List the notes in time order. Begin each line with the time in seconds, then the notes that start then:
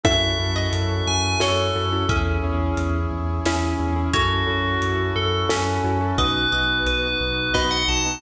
0.04 F#2 C#4 E4 F#4 A4 E5, kick, closed hi-hat
0.39 F#2 C#4 E4 F#4 A4
0.56 D#5
0.73 F#2, closed hi-hat
1.07 F#2 G#5
1.40 F#2 C#4 E4 F#4 A4 C#5, snare
1.76 F#2 C#4 E4 F#4 A4
1.92 C#4 E4 F#4 A4
2.08 E2 C#4 E4 G#4 E5, kick, closed hi-hat
2.43 E2 C#4 E4 G#4
2.77 E2, closed hi-hat
3.11 E2
3.46 E2 C#4 E4 G#4, snare
3.80 E2 C#4 E4 G#4
3.96 C#4 E4 G#4
4.13 F#2 C#4 E4 F#4 A4 C#5, kick, closed hi-hat
4.47 F#2 C#4 E4 F#4 A4
4.82 F#2, closed hi-hat
5.16 F#2 A4
5.49 F#2 C#4 E4 F#4 A4, snare
5.84 F#2 C#4 E4 F#4 A4
6.01 C#4 E4 F#4 A4
6.18 B1 B3 D#4 F#4 B4 D#5, kick, closed hi-hat
6.52 B1 B3 D#4 F#4 D#5
6.86 B1 B4, closed hi-hat
7.20 B1
7.54 B1 B3 D#4 F#4 B4 D#5, kick, snare
7.71 F#5
7.88 B1 B3 D#4 F#4 A5
8.06 B3 D#4 F#4